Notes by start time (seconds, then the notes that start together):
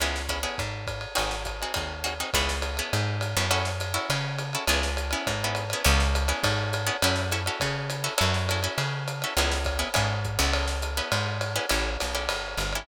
0.00 C#2 B3 C#4 E4 G#4, ride
0.16 snare
0.29 B3 C#4 E4 G#4, kick, hi-hat pedal, ride
0.43 B3 C#4 E4 G#4, ride
0.58 G#2, kick, ride
0.87 kick, hi-hat pedal, ride
1.01 ride
1.15 G#1 C4 D#4 F#4 G#4, ride
1.31 snare
1.45 kick, hi-hat pedal, ride
1.62 C4 D#4 F#4 G#4, ride
1.74 D#2 C4 D#4 F#4 G#4, kick, ride
2.04 C4 D#4 F#4 G#4, hi-hat pedal, ride
2.20 C4 D#4 F#4 G#4, ride
2.33 C#2 B3 C#4 E4 G#4, kick, ride
2.49 snare
2.62 hi-hat pedal, ride
2.77 B3 C#4 E4 G#4, ride
2.93 G#2, ride
3.21 hi-hat pedal, ride
3.37 F#2 B3 C#4 E4 G#4, ride
3.51 C#4 E4 F#4 A4, ride
3.65 snare
3.80 hi-hat pedal, ride
3.94 C#4 E4 F#4 A4, ride
4.10 C#3, ride
4.38 hi-hat pedal, ride
4.53 C#4 E4 F#4 A4, ride
4.67 C#2 B3 C#4 E4 G#4, ride
4.83 snare
4.97 hi-hat pedal, ride
5.11 B3 C#4 E4 G#4, ride
5.27 G#2, kick, ride
5.44 B3 C#4 E4 G#4
5.55 hi-hat pedal, ride
5.70 B3 C#4 E4 G#4, ride
5.84 C#2 B3 C#4 E4 G#4, ride
6.00 snare
6.15 hi-hat pedal, ride
6.28 B3 C#4 E4 G#4, ride
6.43 G#2, kick, ride
6.73 hi-hat pedal, ride
6.87 B3 C#4 E4 G#4, ride
7.02 F#2 C#4 E4 F#4 A4, ride
7.16 snare
7.31 C#4 E4 F#4 A4, hi-hat pedal, ride
7.46 C#4 E4 F#4 A4, ride
7.60 C#3, kick, ride
7.90 hi-hat pedal, ride
8.04 C#4 E4 F#4 A4, ride
8.18 F#2 C#4 E4 F#4 A4, ride
8.34 snare
8.49 C#4 E4 F#4 A4, hi-hat pedal, ride
8.63 C#4 E4 F#4 A4, ride
8.78 C#3, ride
9.08 hi-hat pedal, ride
9.22 C#4 E4 F#4 A4, ride
9.37 C#2 B3 C#4 E4 G#4, ride
9.52 snare
9.64 kick, hi-hat pedal, ride
9.79 B3 C#4 E4 G#4, ride
9.94 G#2 B3 C#4 E4 G#4, kick, ride
10.25 kick, hi-hat pedal
10.39 C#2 B3 C#4 E4 G#4, ride
10.53 ride
10.68 snare
10.82 hi-hat pedal, ride
10.97 B3 C#4 E4 G#4, ride
11.12 G#2, ride
11.41 hi-hat pedal, ride
11.56 B3 C#4 E4 G#4, ride
11.69 A1 C#4 E4 G4 A4, ride
12.00 B1, snare, hi-hat pedal, ride
12.15 C#4 E4 G4 A4, ride
12.29 G1, ride
12.57 G1, hi-hat pedal, ride
12.73 C#4 E4 G4 A4, ride